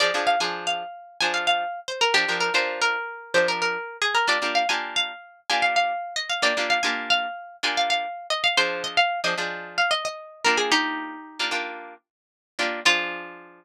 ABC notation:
X:1
M:4/4
L:1/16
Q:1/4=112
K:Fdor
V:1 name="Acoustic Guitar (steel)"
d2 f a2 f4 a f f3 c B | G2 B c2 B4 c B B3 A B | d2 f a2 f4 a f f3 e f | d2 f a2 f4 a f f3 e f |
c2 e f2 e4 f e e3 B A | [EG]8 z8 | F16 |]
V:2 name="Acoustic Guitar (steel)"
[F,DAc] [F,DAc]2 [F,DAc]6 [F,DAc]7 | [F,DB] [F,DGB]2 [F,DGB]6 [F,DGB]7 | [B,DFG] [B,DFG]2 [B,DFG]6 [B,DFG]7 | [B,DFG] [B,DFG]2 [B,DFG]6 [B,DFG]7 |
[F,DA]5 [F,DAc] [F,DAc]8 [B,DFG]2- | [B,DFG]5 [B,DFG] [B,DFG]8 [B,DFG]2 | [F,DAc]16 |]